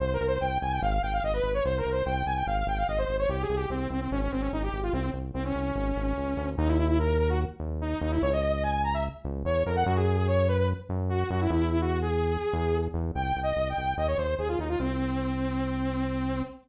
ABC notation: X:1
M:4/4
L:1/16
Q:1/4=146
K:Cphr
V:1 name="Lead 2 (sawtooth)"
(3c2 B2 c2 g2 a g f f g f e _c2 d | (3c2 B2 c2 g2 a g f f g f e c2 d | (3G2 A2 G2 C2 C C D D C D E G2 F | C2 z2 C D11 |
[K:D#phr] D E E E A2 A F z4 D2 D E | c d d d g2 a e z4 c2 A f | F G G G c2 B B z4 F2 F E | E2 E F2 G9 z2 |
[K:Cphr] (3g4 e4 g4 e d c2 A F E F | C16 |]
V:2 name="Synth Bass 1" clef=bass
C,,2 C,,2 C,,2 C,,2 A,,,2 A,,,2 A,,,2 A,,,2 | C,,2 C,,2 C,,2 C,,2 A,,,2 A,,,2 A,,,2 A,,,2 | C,,2 C,,2 C,,2 C,,2 A,,,2 A,,,2 A,,,2 A,,,2 | C,,2 C,,2 C,,2 C,,2 A,,,2 A,,,2 D,,2 =D,,2 |
[K:D#phr] D,,10 D,,4 D,,2 | C,,10 C,,2 E,,2 =F,,2 | F,,10 F,,4 F,,2 | E,,10 E,,4 E,,2 |
[K:Cphr] C,,2 C,,2 C,,2 C,,2 E,,2 E,,2 E,,2 E,,2 | C,,16 |]